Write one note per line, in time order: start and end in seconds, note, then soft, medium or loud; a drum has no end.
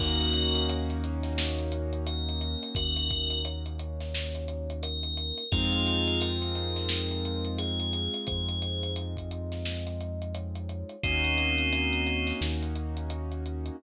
0.00 2.56 D#2 medium
0.00 5.44 A#3 loud
0.00 5.44 C#4 medium
0.00 5.44 D#4 medium
0.00 0.61 F#4 medium
0.00 5.44 F#4 medium
0.00 0.61 A#4 loud
0.00 kick loud
0.00 crash loud
0.21 closed hi-hat medium
0.33 closed hi-hat medium
0.55 closed hi-hat medium
0.69 1.97 C#5 medium
0.69 closed hi-hat loud
0.90 closed hi-hat medium
1.04 closed hi-hat medium
1.23 snare soft
1.23 closed hi-hat medium
1.38 snare loud
1.59 closed hi-hat medium
1.72 closed hi-hat medium
1.93 closed hi-hat medium
2.07 2.68 A#4 medium
2.07 closed hi-hat loud
2.29 closed hi-hat medium
2.41 closed hi-hat medium
2.63 closed hi-hat medium
2.75 5.32 D#2 medium
2.75 3.39 F#4 medium
2.75 3.39 A#4 loud
2.75 kick loud
2.75 closed hi-hat loud
2.96 closed hi-hat medium
3.10 kick medium
3.10 closed hi-hat medium
3.30 closed hi-hat medium
3.45 4.72 C#5 medium
3.45 closed hi-hat loud
3.66 closed hi-hat medium
3.79 closed hi-hat medium
4.00 snare medium
4.00 closed hi-hat medium
4.15 snare loud
4.35 closed hi-hat medium
4.48 closed hi-hat medium
4.70 closed hi-hat medium
4.83 5.44 A#4 loud
4.83 closed hi-hat loud
5.03 closed hi-hat medium
5.17 closed hi-hat medium
5.38 closed hi-hat medium
5.52 8.08 F2 medium
5.52 10.96 G#3 loud
5.52 10.96 C4 loud
5.52 10.96 D#4 medium
5.52 6.19 F4 medium
5.52 10.96 F4 medium
5.52 6.19 G#4 medium
5.52 kick loud
5.52 closed hi-hat loud
5.72 closed hi-hat medium
5.87 closed hi-hat medium
6.08 closed hi-hat medium
6.21 7.46 A#4 medium
6.21 closed hi-hat loud
6.42 closed hi-hat medium
6.55 closed hi-hat medium
6.76 snare medium
6.76 closed hi-hat medium
6.89 snare loud
7.11 closed hi-hat medium
7.25 closed hi-hat medium
7.45 closed hi-hat medium
7.58 8.17 G#4 loud
7.58 closed hi-hat loud
7.80 closed hi-hat medium
7.93 closed hi-hat medium
8.14 closed hi-hat medium
8.27 10.84 F2 medium
8.27 8.91 G#4 medium
8.27 8.91 C5 medium
8.27 kick loud
8.27 closed hi-hat medium
8.49 closed hi-hat medium
8.62 closed hi-hat medium
8.83 closed hi-hat medium
8.96 10.29 D#5 medium
8.96 closed hi-hat medium
9.17 kick medium
9.17 closed hi-hat medium
9.31 closed hi-hat medium
9.52 snare medium
9.52 closed hi-hat medium
9.65 snare loud
9.87 closed hi-hat medium
10.01 closed hi-hat medium
10.22 closed hi-hat medium
10.34 10.93 C#5 medium
10.34 closed hi-hat loud
10.55 closed hi-hat medium
10.69 closed hi-hat medium
10.89 closed hi-hat medium
11.03 12.32 D#2 medium
11.03 13.76 A#3 medium
11.03 12.30 C4 medium
11.03 13.76 C#4 loud
11.03 12.30 D#4 medium
11.03 13.76 D#4 medium
11.03 13.76 F#4 medium
11.03 kick loud
11.03 closed hi-hat loud
11.24 closed hi-hat medium
11.38 closed hi-hat medium
11.58 closed hi-hat medium
11.73 closed hi-hat loud
11.93 closed hi-hat medium
12.07 closed hi-hat medium
12.27 snare medium
12.27 closed hi-hat medium
12.41 13.70 D#2 medium
12.41 snare loud
12.63 closed hi-hat medium
12.75 closed hi-hat medium
12.97 closed hi-hat medium
13.10 closed hi-hat loud
13.32 closed hi-hat medium
13.46 closed hi-hat medium
13.66 closed hi-hat medium